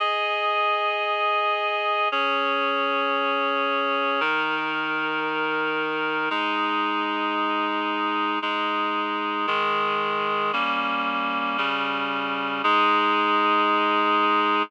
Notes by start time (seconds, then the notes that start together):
0.00 G#4 D#5 G#5
2.12 C#4 G#4 C#5
4.20 D#3 D#4 A#4
6.30 G#3 D#4 G#4
8.42 G#3 D#4 G#4
9.47 D#3 G#3 G#4
10.53 G3 A#3 C#4
11.58 C#3 G3 C#4
12.64 G#3 D#4 G#4